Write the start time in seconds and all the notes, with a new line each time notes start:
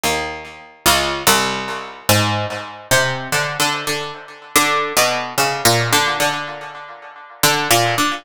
0.04 D#2
0.86 C#2
1.27 C2
2.09 G#2
2.91 C3
3.32 D3
3.60 D3
3.87 D3
4.56 D3
4.97 B2
5.38 C#3
5.65 A#2
5.93 D3
6.20 D3
7.43 D3
7.71 A#2
7.98 D3